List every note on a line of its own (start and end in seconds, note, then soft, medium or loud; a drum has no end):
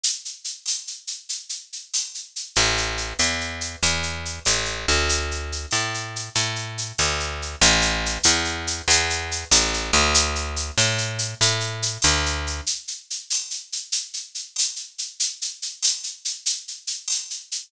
0.04 shaker medium
0.25 shaker medium
0.44 shaker medium
0.66 tambourine medium
0.66 shaker medium
0.87 shaker medium
1.07 shaker medium
1.29 shaker medium
1.49 shaker medium
1.73 shaker medium
1.94 tambourine medium
1.94 shaker medium
2.14 shaker medium
2.36 shaker medium
2.56 3.14 A1 medium
2.56 shaker medium
2.77 shaker medium
2.97 shaker medium
3.19 3.76 E2 medium
3.19 tambourine medium
3.19 shaker medium
3.41 shaker soft
3.61 shaker medium
3.82 4.40 E2 medium
3.82 shaker medium
4.03 shaker medium
4.25 shaker medium
4.45 4.86 A1 medium
4.45 tambourine medium
4.45 shaker medium
4.65 shaker medium
4.88 5.66 D2 medium
4.88 shaker medium
5.09 shaker medium
5.31 shaker medium
5.52 shaker medium
5.71 6.29 A2 medium
5.71 tambourine medium
5.71 shaker medium
5.94 shaker medium
6.16 shaker medium
6.35 6.92 A2 medium
6.35 shaker medium
6.56 shaker medium
6.78 shaker medium
6.98 7.56 D2 medium
6.98 tambourine medium
6.98 shaker medium
7.20 shaker medium
7.42 shaker medium
7.61 8.18 A1 medium
7.61 shaker loud
7.81 shaker medium
8.06 shaker medium
8.23 8.82 E2 medium
8.23 tambourine medium
8.23 shaker loud
8.45 shaker medium
8.67 shaker medium
8.88 9.45 E2 medium
8.88 shaker loud
9.10 shaker medium
9.31 shaker medium
9.51 9.91 A1 medium
9.51 tambourine medium
9.51 shaker loud
9.74 shaker medium
9.93 10.71 D2 medium
9.93 shaker medium
10.14 shaker loud
10.35 shaker medium
10.56 shaker medium
10.78 11.34 A2 medium
10.78 tambourine medium
10.78 shaker medium
10.98 shaker medium
11.19 shaker medium
11.41 11.98 A2 medium
11.41 shaker loud
11.60 shaker medium
11.82 shaker medium
12.02 12.61 D2 medium
12.02 tambourine medium
12.02 shaker medium
12.26 shaker medium
12.47 shaker medium
12.66 shaker medium
12.88 shaker medium
13.10 shaker medium
13.30 tambourine medium
13.30 shaker medium
13.51 shaker medium
13.72 shaker medium
13.92 shaker medium
14.14 shaker medium
14.35 shaker medium
14.56 tambourine medium
14.56 shaker medium
14.76 shaker medium
14.98 shaker medium
15.20 shaker medium
15.42 shaker medium
15.62 shaker medium
15.83 tambourine medium
15.83 shaker loud
16.03 shaker medium
16.25 shaker medium
16.46 shaker medium
16.68 shaker medium
16.87 shaker medium
17.08 tambourine medium
17.08 shaker medium
17.30 shaker medium
17.52 shaker medium